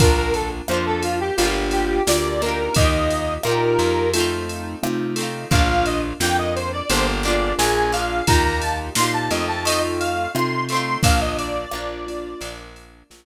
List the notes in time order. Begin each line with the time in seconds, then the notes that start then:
0.00 A#1 A#3 D4 F4 A#4, kick, ride
0.04 F4
0.17 A#4
0.34 A4, ride
0.68 F2 A#3 D4 F4 C5, cross-stick
0.74 F4
0.86 A4
1.02 F4, ride
1.21 G4
1.37 G1 A#3 D4 F4 G4, ride
1.42 F4 G4
1.71 G4, ride
2.07 D2 A#3 D4 F4 G4 D5, snare
2.42 A#3 D4 D#4 F4 G4 A#4, ride
2.46 F4 G4
2.74 D#2 A#3 D#4 D#5, kick, ride
2.80 F4 G4
3.10 ride
3.43 A#2 A#3 D#4 F4 G4 A#4, cross-stick
3.49 F4 G4
3.79 F2, ride
4.14 A3 C4 D#4 F4, ride
4.18 D#4 F4
4.49 ride
4.83 C3 A3 C4 D#4 F4, cross-stick
5.16 A3 C4, ride
5.20 D#4 F4
5.51 A#1 A#3 D4 F4 F5, kick, ride
5.55 F4
5.69 F5
5.85 D#5, ride
6.20 F2 A#3 D4 F4 G5, snare
6.25 F4
6.38 D#5
6.55 C5, ride
6.73 D5
6.90 G1 A#3 D4 F4 G4 C5, ride
6.95 F4 G4
7.23 A#3 D4 D5, ride
7.28 F4 G#4
7.58 A#1 A#3 D4 F4 G#4 G#5, snare
7.92 A#3 D4 F5, ride
7.97 F4 G#4
8.27 D#2 A#3 D#4 F4 G4 A#5, kick, ride
8.32 F4 G4
8.45 A#5
8.61 A5, ride
8.95 A#2 A#3 D#4 F4 G4 C6, snare
9.01 F4 G4
9.14 A5
9.31 F2 A3 C4 D#4 F4 D#5, ride
9.48 A5
9.65 A3 C4 D#5, ride
9.70 D#4 F4
10.00 F5, ride
10.34 C3 A3 C4 D#4 F4 C6, cross-stick
10.69 A3 C4 C6, ride
10.74 D#4 F4
11.03 A#1 A#3 D4 F4 F5, kick, ride
11.07 F4
11.21 D#5
11.38 D5, ride
11.71 A#1 A#3 D4 F4, cross-stick
11.78 F4
12.07 A#3 D4 F4, ride
12.41 A#1 A#3 D4, ride
12.45 F4
12.76 ride
13.10 A#1 A#3 D4 F4, snare